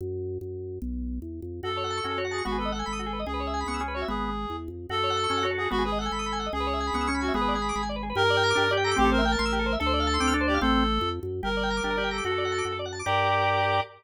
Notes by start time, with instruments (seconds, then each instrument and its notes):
0.01 drawbar organ F#2
0.41 drawbar organ F#2
0.82 drawbar organ B1
1.22 drawbar organ E2
1.42 drawbar organ F2
1.63 drawbar organ F#2 F#4, clarinet A4
1.70 drawbar organ A4
1.77 drawbar organ C#5
1.84 drawbar organ F#5
1.90 drawbar organ A5
1.97 drawbar organ C#6
2.04 drawbar organ F#2 C#4 F#4
2.11 drawbar organ A4
2.18 drawbar organ F#4 C#5
2.25 drawbar organ F#5
2.31 clarinet G#4, drawbar organ A5
2.38 drawbar organ C#6
2.45 drawbar organ G#1 B3 F#4, clarinet F#4
2.52 drawbar organ G#4
2.58 clarinet A4, drawbar organ B4
2.65 drawbar organ D#5
2.72 clarinet A4, drawbar organ F#5
2.79 drawbar organ G#5
2.86 drawbar organ G#1 B5
2.93 drawbar organ D#6
2.99 drawbar organ F#4
3.06 drawbar organ G#4
3.13 drawbar organ B4
3.19 drawbar organ D#5
3.26 drawbar organ C#2 G#4, clarinet G#4
3.34 drawbar organ B4
3.40 drawbar organ C#5
3.47 drawbar organ E5
3.54 drawbar organ G#5
3.61 drawbar organ B5
3.66 drawbar organ C#2 B3 C#6
3.74 drawbar organ E6
3.80 drawbar organ C#4 G#4
3.88 drawbar organ B4
3.95 clarinet F#4, drawbar organ C#5
4.02 drawbar organ E5
4.08 drawbar organ G#1 B3, clarinet G#4
4.50 drawbar organ E2
4.68 drawbar organ F2
4.89 drawbar organ F#2 F#4, clarinet A4
4.97 drawbar organ A4
5.03 drawbar organ C#5
5.10 drawbar organ F#5
5.17 drawbar organ A5
5.24 drawbar organ C#6
5.30 drawbar organ F#2 C#4 A5
5.37 drawbar organ F#5
5.43 drawbar organ F#4 C#5
5.51 drawbar organ A4
5.58 drawbar organ F#4, clarinet G#4
5.65 drawbar organ A4
5.71 drawbar organ G#1 B3 F#4, clarinet F#4
5.78 drawbar organ G#4
5.85 clarinet G#4, drawbar organ B4
5.92 drawbar organ D#5
5.99 clarinet A4, drawbar organ F#5
6.06 drawbar organ G#5
6.12 drawbar organ G#1 B5
6.19 drawbar organ D#6
6.26 drawbar organ B5
6.32 drawbar organ G#5
6.40 drawbar organ F#5
6.46 drawbar organ D#5
6.53 drawbar organ C#2 G#4, clarinet G#4
6.60 drawbar organ B4
6.67 drawbar organ C#5
6.73 drawbar organ E5
6.80 drawbar organ G#5
6.87 drawbar organ B5
6.93 drawbar organ C#2 B3 C#6
7.01 drawbar organ E6
7.07 drawbar organ C#4 C#6
7.14 drawbar organ B5
7.21 clarinet F#4, drawbar organ G#5
7.28 drawbar organ E5
7.34 drawbar organ G#1 B3 G#4, clarinet G#4
7.41 drawbar organ B4
7.48 drawbar organ D5
7.55 drawbar organ G#5
7.62 drawbar organ B5
7.69 drawbar organ D6
7.76 drawbar organ G#1 B5
7.83 drawbar organ G#5
7.89 drawbar organ D5
7.96 drawbar organ B4
8.03 drawbar organ G#4
8.10 drawbar organ B4
8.15 drawbar organ G2 G4, clarinet A#4
8.23 drawbar organ A#4
8.30 drawbar organ D5
8.37 drawbar organ G5
8.43 drawbar organ A#5
8.50 drawbar organ D6
8.55 drawbar organ G2 D4 G4
8.64 drawbar organ A#4
8.71 drawbar organ G4 D5
8.77 drawbar organ G5
8.84 clarinet A4, drawbar organ A#5
8.91 drawbar organ D6
8.96 drawbar organ A1 C4 G4, clarinet G4
9.05 drawbar organ A4
9.12 clarinet A#4, drawbar organ C5
9.18 drawbar organ E5
9.25 clarinet A#4, drawbar organ G5
9.32 drawbar organ A5
9.39 drawbar organ A1 C6
9.45 drawbar organ E6
9.52 drawbar organ G4
9.59 drawbar organ A4
9.66 drawbar organ C5
9.73 drawbar organ E5
9.79 drawbar organ D2 A4, clarinet A4
9.86 drawbar organ C5
9.93 drawbar organ D5
10.00 drawbar organ F5
10.07 drawbar organ A5
10.14 drawbar organ C6
10.20 drawbar organ D2 C4 D6
10.27 drawbar organ F6
10.34 drawbar organ D4 A4
10.41 drawbar organ C5
10.48 clarinet G4, drawbar organ D5
10.54 drawbar organ F5
10.61 drawbar organ A1 C4, clarinet A4
11.01 drawbar organ F2
11.23 drawbar organ F#2
11.43 drawbar organ G1 G4, clarinet A#4
11.50 drawbar organ A#4
11.57 drawbar organ D5
11.63 drawbar organ G5
11.70 drawbar organ A#5
11.77 drawbar organ D6
11.83 drawbar organ G1 D4 G4
11.90 drawbar organ A#4
11.97 drawbar organ G4 D5
12.04 drawbar organ G5
12.11 clarinet A4, drawbar organ A#5
12.18 drawbar organ D6
12.24 drawbar organ F#2 F#4, clarinet A4
12.32 drawbar organ A4
12.38 drawbar organ D5
12.45 drawbar organ F#5
12.52 drawbar organ A5
12.58 drawbar organ D6
12.65 drawbar organ F#2 F#4
12.72 drawbar organ A4
12.79 drawbar organ D5
12.86 drawbar organ F#5
12.92 drawbar organ A5
12.99 drawbar organ D6
13.06 drawbar organ G2 G4 A#4 D5, clarinet G4